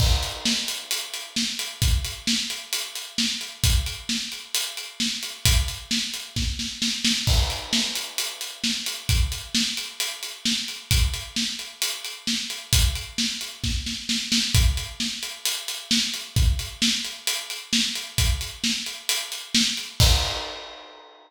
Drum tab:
CC |x-------|--------|--------|--------|
HH |-x-xxx-x|xx-xxx-x|xx-xxx-x|xx-x----|
SD |--o---o-|--o---o-|--o---o-|--o-oooo|
BD |o-------|o-------|o-------|o---o---|

CC |x-------|--------|--------|--------|
HH |-x-xxx-x|xx-xxx-x|xx-xxx-x|xx-x----|
SD |--o---o-|--o---o-|--o---o-|--o-oooo|
BD |o-------|o-------|o-------|o---o---|

CC |--------|--------|--------|x-------|
HH |xx-xxx-x|xx-xxx-x|xx-xxx-x|--------|
SD |--o---o-|--o---o-|--o---o-|--------|
BD |o-------|o-------|o-------|o-------|